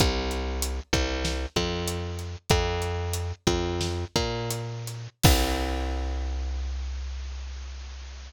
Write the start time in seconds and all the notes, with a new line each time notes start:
0.00 C2, kick, closed hi-hat
0.31 closed hi-hat
0.62 closed hi-hat
0.93 C2, kick, closed hi-hat
1.25 snare
1.56 F2, kick, closed hi-hat
1.88 closed hi-hat
2.19 closed hi-hat
2.50 F2, kick, closed hi-hat
2.82 closed hi-hat
3.13 closed hi-hat
3.47 F2, kick, closed hi-hat
3.81 snare
4.16 A#2, kick, closed hi-hat
4.51 closed hi-hat
4.87 closed hi-hat
5.23 C2, kick, crash